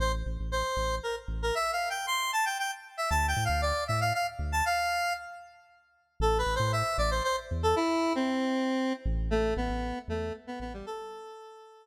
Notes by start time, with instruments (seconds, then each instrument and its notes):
0.00 synth bass 2 A1, lead 1 (square) C5
0.26 synth bass 2 A1
0.40 synth bass 2 A1
0.52 lead 1 (square) C5
0.77 synth bass 2 A1
1.03 lead 1 (square) A#4
1.28 synth bass 2 A1
1.42 lead 1 (square) A#4
1.55 lead 1 (square) E5
1.73 lead 1 (square) F5
1.90 lead 1 (square) G5
2.07 lead 1 (square) C6
2.33 lead 1 (square) A5
2.45 lead 1 (square) G5
2.59 lead 1 (square) G5
2.97 lead 1 (square) E5
3.10 synth bass 2 D2, lead 1 (square) A5
3.28 lead 1 (square) G5
3.36 synth bass 2 A2
3.45 lead 1 (square) F5
3.49 synth bass 2 D2
3.62 lead 1 (square) D5
3.88 synth bass 2 A2, lead 1 (square) E5
4.01 lead 1 (square) F5
4.14 lead 1 (square) F5
4.39 synth bass 2 D2
4.52 lead 1 (square) A5
4.66 lead 1 (square) F5
6.20 synth bass 2 A1, lead 1 (square) A4
6.38 lead 1 (square) B4
6.46 synth bass 2 A1
6.55 lead 1 (square) C5
6.60 synth bass 2 A2
6.72 lead 1 (square) E5
6.98 synth bass 2 A1, lead 1 (square) D5
7.11 lead 1 (square) C5
7.24 lead 1 (square) C5
7.51 synth bass 2 E2
7.63 lead 1 (square) A4
7.76 lead 1 (square) E4
8.15 lead 1 (square) C4
9.05 synth bass 2 A1
9.31 lead 1 (square) A3
9.57 synth bass 2 A1, lead 1 (square) B3
9.69 synth bass 2 A1
10.08 synth bass 2 E2, lead 1 (square) A3
10.47 lead 1 (square) B3
10.60 synth bass 2 A1, lead 1 (square) B3
10.73 lead 1 (square) G3
10.86 lead 1 (square) A4